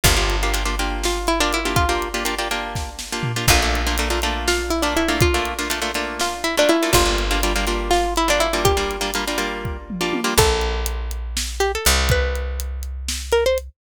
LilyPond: <<
  \new Staff \with { instrumentName = "Pizzicato Strings" } { \time 7/8 \key bes \lydian \tempo 4 = 122 f'2 f'8 e'16 d'16 e'8 | f'2 r4. | f'2 f'8 e'16 d'16 e'8 | f'2 f'8 e'16 d'16 e'8 |
f'2 f'8 e'16 d'16 e'8 | g'4. r2 | a'2 r8 g'16 a'16 r8 | b'2 r8 bes'16 c''16 r8 | }
  \new Staff \with { instrumentName = "Pizzicato Strings" } { \time 7/8 \key bes \lydian <bes d' f' g'>16 <bes d' f' g'>8 <bes d' f' g'>16 <bes d' f' g'>16 <bes d' f' g'>16 <bes d' f' g'>4~ <bes d' f' g'>16 <bes d' f' g'>8 <bes d' f' g'>16~ | <bes d' f' g'>16 <bes d' f' g'>8 <bes d' f' g'>16 <bes d' f' g'>16 <bes d' f' g'>16 <bes d' f' g'>4~ <bes d' f' g'>16 <bes d' f' g'>8 <bes d' f' g'>16 | <a bes d' f'>16 <a bes d' f'>8 <a bes d' f'>16 <a bes d' f'>16 <a bes d' f'>16 <a bes d' f'>4~ <a bes d' f'>16 <a bes d' f'>8 <a bes d' f'>16~ | <a bes d' f'>16 <a bes d' f'>8 <a bes d' f'>16 <a bes d' f'>16 <a bes d' f'>16 <a bes d' f'>4~ <a bes d' f'>16 <a bes d' f'>8 <a bes d' f'>16 |
<g bes d' f'>16 <g bes d' f'>8 <g bes d' f'>16 <g bes d' f'>16 <g bes d' f'>16 <g bes d' f'>4~ <g bes d' f'>16 <g bes d' f'>8 <g bes d' f'>16~ | <g bes d' f'>16 <g bes d' f'>8 <g bes d' f'>16 <g bes d' f'>16 <g bes d' f'>16 <g bes d' f'>4~ <g bes d' f'>16 <g bes d' f'>8 <g bes d' f'>16 | r2. r8 | r2. r8 | }
  \new Staff \with { instrumentName = "Electric Bass (finger)" } { \clef bass \time 7/8 \key bes \lydian g,,2.~ g,,8~ | g,,2.~ g,,8 | bes,,2.~ bes,,8~ | bes,,2.~ bes,,8 |
g,,2.~ g,,8~ | g,,2.~ g,,8 | bes,,2. c,8~ | c,2.~ c,8 | }
  \new DrumStaff \with { instrumentName = "Drums" } \drummode { \time 7/8 <hh bd>8 hh8 hh8 hh8 sn8 hh8 hh8 | <hh bd>8 hh8 hh8 hh8 <bd sn>8 sn8 tomfh8 | <cymc bd>8 hh8 hh8 hh8 sn8 hh8 hh8 | <hh bd>8 hh8 hh8 hh8 sn8 hh8 hh8 |
<hh bd>8 hh8 hh8 hh8 sn8 hh8 hh8 | <hh bd>8 hh8 hh8 hh8 bd8 toml8 tommh8 | <cymc bd>8 hh8 hh8 hh8 sn8 hh8 hh8 | <hh bd>8 hh8 hh8 hh8 sn8 hh8 hh8 | }
>>